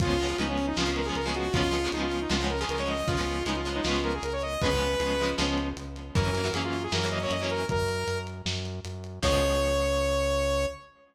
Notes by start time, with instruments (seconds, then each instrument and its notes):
0.00 synth bass 1 C#2, acoustic guitar (steel) F3 G#3 B3, lead 2 (sawtooth) F4, kick, closed hi-hat
0.05 acoustic guitar (steel) C#4
0.19 acoustic guitar (steel) F3 G#3 B3, closed hi-hat
0.23 acoustic guitar (steel) C#4
0.29 acoustic guitar (steel) F3 G#3 B3 C#4
0.38 synth bass 1 C#2, acoustic guitar (steel) F3 G#3 B3 C#4, lead 2 (sawtooth) D#4, closed hi-hat
0.49 lead 2 (sawtooth) C#4
0.58 closed hi-hat
0.67 lead 2 (sawtooth) D#4
0.76 synth bass 1 C#2, acoustic guitar (steel) F3 G#3 B3 C#4, lead 2 (sawtooth) F4, snare
0.86 acoustic guitar (steel) F3 G#3 B3 C#4
0.96 lead 2 (sawtooth) A#4, closed hi-hat
1.05 acoustic guitar (steel) F3 G#3 B3 C#4, lead 2 (sawtooth) G#4
1.15 synth bass 1 C#2, lead 2 (sawtooth) A#4, closed hi-hat
1.26 acoustic guitar (steel) F3 G#3 B3 C#4, lead 2 (sawtooth) G#4
1.35 lead 2 (sawtooth) F#4, closed hi-hat
1.53 synth bass 1 C#2, acoustic guitar (steel) F3 G#3 B3 C#4, lead 2 (sawtooth) F4, kick, closed hi-hat
1.71 acoustic guitar (steel) F3 G#3 B3 C#4, closed hi-hat
1.84 acoustic guitar (steel) F3 G#3 B3 C#4
1.92 synth bass 1 C#2, acoustic guitar (steel) F3 G#3, lead 2 (sawtooth) D#4, closed hi-hat
1.96 acoustic guitar (steel) B3 C#4
2.02 lead 2 (sawtooth) F4
2.12 closed hi-hat
2.21 lead 2 (sawtooth) D#4
2.30 synth bass 1 C#2, acoustic guitar (steel) F3 G#3 B3 C#4, lead 2 (sawtooth) F4, snare
2.40 acoustic guitar (steel) F3 G#3 B3 C#4
2.50 lead 2 (sawtooth) A#4, closed hi-hat
2.60 acoustic guitar (steel) F3 G#3 B3, lead 2 (sawtooth) G#4
2.64 acoustic guitar (steel) C#4
2.69 synth bass 1 C#2, lead 2 (sawtooth) A#4, closed hi-hat
2.78 acoustic guitar (steel) F3 G#3 B3 C#4, lead 2 (sawtooth) C#5
2.88 lead 2 (sawtooth) D#5, open hi-hat
3.07 synth bass 1 C#2, acoustic guitar (steel) F3 G#3 B3, lead 2 (sawtooth) F4, kick, closed hi-hat
3.11 acoustic guitar (steel) C#4
3.17 acoustic guitar (steel) F3 G#3 B3 C#4
3.27 closed hi-hat
3.45 synth bass 1 C#2, acoustic guitar (steel) F3 G#3 B3 C#4, lead 2 (sawtooth) D#4, closed hi-hat
3.56 lead 2 (sawtooth) F4
3.65 acoustic guitar (steel) F3 G#3 B3, closed hi-hat
3.69 acoustic guitar (steel) C#4
3.75 lead 2 (sawtooth) D#4
3.84 synth bass 1 C#2, acoustic guitar (steel) F3 G#3 B3 C#4, lead 2 (sawtooth) F4, snare
4.04 lead 2 (sawtooth) A#4, closed hi-hat
4.14 lead 2 (sawtooth) G#4
4.23 synth bass 1 C#2, lead 2 (sawtooth) A#4, closed hi-hat
4.33 lead 2 (sawtooth) C#5
4.42 lead 2 (sawtooth) D#5, closed hi-hat
4.61 synth bass 1 C#2, acoustic guitar (steel) F3 G#3 B3, lead 2 (sawtooth) B4, kick, closed hi-hat
4.65 acoustic guitar (steel) C#4
4.72 acoustic guitar (steel) F3 G#3 B3 C#4
4.81 closed hi-hat
5.00 synth bass 1 C#2, acoustic guitar (steel) F3 G#3 B3 C#4, closed hi-hat
5.19 acoustic guitar (steel) F3 G#3 B3, closed hi-hat
5.23 acoustic guitar (steel) C#4
5.38 synth bass 1 C#2, acoustic guitar (steel) F3 G#3 B3 C#4, snare
5.58 closed hi-hat
5.77 synth bass 1 C#2, closed hi-hat
5.96 closed hi-hat
6.15 synth bass 1 F#2, acoustic guitar (steel) E3 F#3 A#3 C#4, lead 2 (sawtooth) A#4, kick, closed hi-hat
6.34 acoustic guitar (steel) E3 F#3 A#3 C#4, closed hi-hat
6.44 acoustic guitar (steel) E3 F#3 A#3 C#4
6.53 synth bass 1 F#2, acoustic guitar (steel) E3 F#3 A#3 C#4, lead 2 (sawtooth) G#4, closed hi-hat
6.64 lead 2 (sawtooth) F4
6.73 closed hi-hat
6.83 lead 2 (sawtooth) G#4
6.92 synth bass 1 F#2, acoustic guitar (steel) E3 F#3 A#3 C#4, lead 2 (sawtooth) A#4, snare
7.04 acoustic guitar (steel) E3 F#3 A#3 C#4
7.11 lead 2 (sawtooth) D#5, closed hi-hat
7.22 acoustic guitar (steel) E3 F#3 A#3 C#4, lead 2 (sawtooth) C#5
7.31 synth bass 1 F#2, lead 2 (sawtooth) D#5, closed hi-hat
7.40 acoustic guitar (steel) E3 F#3 A#3 C#4, lead 2 (sawtooth) C#5
7.50 lead 2 (sawtooth) A#4, closed hi-hat
7.69 synth bass 1 F#2, lead 2 (sawtooth) A#4, kick, closed hi-hat
7.88 closed hi-hat
8.07 synth bass 1 F#2, closed hi-hat
8.27 closed hi-hat
8.46 synth bass 1 F#2, snare
8.65 closed hi-hat
8.85 synth bass 1 F#2, closed hi-hat
9.04 closed hi-hat
9.22 synth bass 1 C#2, acoustic guitar (steel) F3 G#3 B3 C#4, lead 2 (sawtooth) C#5, kick, crash